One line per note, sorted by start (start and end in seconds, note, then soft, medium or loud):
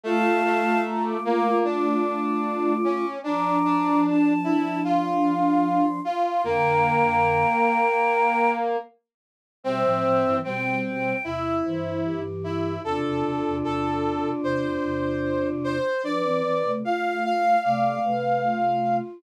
0.04 0.42 A3 medium
0.04 3.05 A3 loud
0.04 3.05 F4 loud
0.04 0.81 F5 loud
0.04 0.81 A5 loud
0.45 1.17 A3 medium
0.84 1.03 A#5 loud
1.04 1.23 D6 medium
1.24 1.64 A#3 medium
1.24 1.58 D6 loud
1.64 2.74 D4 medium
1.64 3.08 D6 medium
2.84 3.19 C#4 medium
3.24 6.00 F3 loud
3.24 3.57 D4 medium
3.24 6.00 D4 loud
3.24 4.00 A#5 medium
3.24 4.00 D6 loud
3.65 4.33 D4 medium
4.04 4.81 A5 medium
4.44 4.79 E4 medium
4.84 5.85 F4 medium
4.84 6.00 C6 loud
6.04 6.42 F4 medium
6.04 6.23 C6 medium
6.24 6.43 C6 loud
6.44 7.45 F2 loud
6.44 7.45 D3 loud
6.44 8.77 A#3 medium
6.44 8.50 G5 loud
6.44 8.50 A#5 loud
9.64 9.83 B2 loud
9.64 9.83 G3 loud
9.64 10.37 C4 medium
9.64 10.36 C5 loud
9.64 10.36 E5 loud
9.84 10.03 A2 medium
9.84 10.03 F3 loud
10.04 10.23 A2 medium
10.04 10.23 F3 loud
10.24 10.43 G2 loud
10.24 10.43 E3 loud
10.44 11.13 B2 medium
10.44 11.13 G3 loud
10.44 11.14 C4 medium
10.44 10.78 G5 loud
10.85 11.23 G5 loud
11.24 11.62 E2 medium
11.24 11.62 C3 medium
11.24 12.21 E4 medium
11.24 11.57 E5 loud
11.65 12.78 G2 medium
11.65 12.78 E3 loud
11.65 12.00 C5 loud
12.04 12.74 G4 loud
12.44 12.81 E4 medium
12.84 13.03 E2 loud
12.84 13.03 C3 loud
12.84 15.77 D4 loud
12.84 15.77 F4 loud
12.84 13.56 A4 medium
13.05 13.23 E2 loud
13.05 13.23 C3 loud
13.24 13.43 E2 medium
13.24 13.43 C3 loud
13.45 13.62 E2 loud
13.45 13.62 C3 loud
13.63 14.33 E2 medium
13.63 14.33 C3 loud
13.63 14.30 A4 medium
14.43 14.77 E2 medium
14.43 14.77 C3 loud
14.43 15.47 C5 medium
14.83 15.80 E2 medium
14.83 15.80 C3 loud
15.64 16.02 C5 medium
16.03 16.22 F3 medium
16.03 16.22 D4 loud
16.03 16.72 B4 loud
16.03 16.69 D5 medium
16.03 16.72 D5 loud
16.23 16.42 E3 medium
16.23 16.42 C4 loud
16.44 16.63 E3 medium
16.44 16.63 C4 loud
16.64 16.83 C3 medium
16.64 16.83 A3 loud
16.84 17.56 A3 medium
16.84 17.56 F4 medium
16.84 17.23 F5 loud
16.84 17.23 F5 medium
17.24 17.59 F5 loud
17.24 17.63 F5 medium
17.64 17.99 C3 loud
17.64 17.99 A3 loud
17.64 18.01 D5 loud
17.64 18.96 F5 medium
18.04 19.01 C3 medium
18.04 19.01 A3 loud
18.04 18.42 B4 loud
18.44 19.19 F4 loud